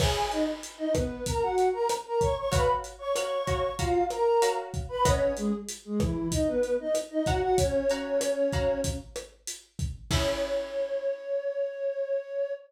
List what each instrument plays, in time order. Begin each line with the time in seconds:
0.00 flute G#4 G#5, acoustic guitar (steel) C#5 E5 G#5, kick, cross-stick, crash
0.31 flute D#4 D#5, closed hi-hat
0.63 closed hi-hat
0.78 flute D#4 D#5
0.94 flute B3 B4, kick, cross-stick, closed hi-hat
1.26 flute A#4 A#5, kick, closed hi-hat
1.42 flute F#4 F#5
1.58 closed hi-hat
1.73 flute A#4 A#5
1.89 cross-stick, closed hi-hat
2.06 flute A#4 A#5
2.20 flute C#5 C#6, kick, closed hi-hat
2.37 flute C#5 C#6
2.52 acoustic guitar (steel) F#4 C#5 F5 A#5, flute B4 B5, kick, closed hi-hat
2.84 closed hi-hat
2.99 flute C#5 C#6
3.14 acoustic guitar (steel) F#4 C#5 F5 A#5, flute C#5 C#6, cross-stick, closed hi-hat
3.47 acoustic guitar (steel) F#4 C#5 F5 A#5, kick, closed hi-hat
3.78 flute F4 F5, acoustic guitar (steel) F#4 C#5 F5 A#5, kick, closed hi-hat
4.10 flute A#4 A#5, cross-stick, closed hi-hat
4.42 acoustic guitar (steel) F#4 C#5 F5 A#5, closed hi-hat
4.74 kick, closed hi-hat
4.89 flute B4 B5
5.05 flute C#4 C#5, acoustic guitar (steel) B4 D#5 F#5 A#5, kick, cross-stick, closed hi-hat
5.37 flute G#3 G#4, closed hi-hat
5.69 closed hi-hat
5.85 flute G#3 G#4
6.00 flute E3 E4, kick, cross-stick, closed hi-hat
6.32 flute D#4 D#5, kick, closed hi-hat
6.47 flute B3 B4
6.63 closed hi-hat
6.80 flute D#4 D#5
6.95 cross-stick, closed hi-hat
7.10 flute D#4 D#5
7.26 acoustic guitar (steel) F#4 C#5 F5 A#5, flute F#4 F#5, kick, closed hi-hat
7.41 flute F#4 F#5
7.56 flute C#4 C#5, kick, closed hi-hat
7.89 acoustic guitar (steel) F#4 C#5 F5 A#5, closed hi-hat
8.21 cross-stick, closed hi-hat
8.53 acoustic guitar (steel) F#4 C#5 F5 A#5, kick, closed hi-hat
8.84 kick, closed hi-hat
9.16 cross-stick, closed hi-hat
9.47 closed hi-hat
9.79 kick, closed hi-hat
10.10 acoustic guitar (steel) C#4 E4 G#4, flute C#5, kick, crash